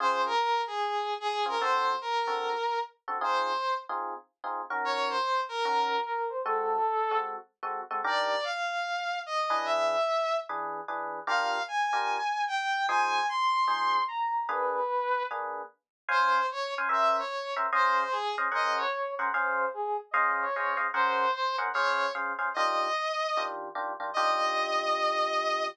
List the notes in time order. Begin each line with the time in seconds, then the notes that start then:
0.00 C#3 C4 F4 G#4 C5
0.25 A#4
0.67 G#4
1.20 G#4
1.46 C#3 C4 F4 G#4 A#4
1.60 D3 C4 F#4 A4 C5
2.01 A#4
2.27 D3 C4 F#4 A4
3.08 D3 C4 F#4 A4
3.21 C4 D#4 F4 G#4 C5
3.89 C4 D#4 F4 G#4
4.44 C4 D#4 F4 G#4
4.70 D#3 C#4 F#4 A#4
4.84 C#5
5.09 C5
5.49 A#4
5.65 D#3 C#4 F#4 A#4
6.06 A#4
6.29 C5
6.44 G#3 C4 F#4 A4
7.11 G#3 C4 F#4 A4
7.63 G#3 C4 F#4 A4
7.91 G#3 C4 F#4 A4
8.04 D#3 D4 G4 A#4 D5
8.44 F5
9.26 D#5
9.50 E3 D4 G#4 B4
9.65 E5
10.49 E3 D4 G#4 B4
10.88 E3 D4 G#4 B4
11.27 D4 F4 G4 A#4 F5
11.68 G#5
11.93 D4 F4 G4 A#4
12.47 G5
12.88 F3 D#4 G#4 C5 G#5
13.29 C6
13.68 F3 D#4 G#4 C5
14.08 A#5
14.49 A#3 D4 G#4 B4
15.31 A#3 D4 G#4 B4
16.09 C#4 C5 F5 G#5
16.51 C#5
16.78 C#4 C5 F5 G#5
16.89 C#4 A#4 C5 E5
17.18 C#5
17.56 C#4 A#4 C5 E5
17.72 C#4 G#4 C5 D#5 F5
18.11 G#4
18.38 C#4 G#4 C5 D#5 F5
18.52 C#4 G#4 A#4 C5 D#5 F#5
18.77 C#5
19.19 C#4 G#4 A#4 C5 F#5
19.33 C#4 G#4 C5 F5
19.73 G#4
20.11 C#4 G#4 C5 D#5 F5
20.41 C#5
20.56 C#4 G#4 C5 D#5 F5
20.77 C#4 G#4 C5 D#5 F5
20.94 C#4 G#4 A#4 C5 F#5
21.33 C5
21.58 C#4 G#4 A#4 C5 F#5
21.73 C#4 G#4 C5 C#5 F5
22.15 C#4 G#4 C5 F5
22.39 C#4 G#4 C5 F5
22.54 D#3 D4 F4 G4 D#5
23.37 D#3 D4 F4 G4
23.75 D#3 D4 F4 G4
24.00 D#3 D4 F4 G4
24.14 D#3 D4 F4 G4 D#5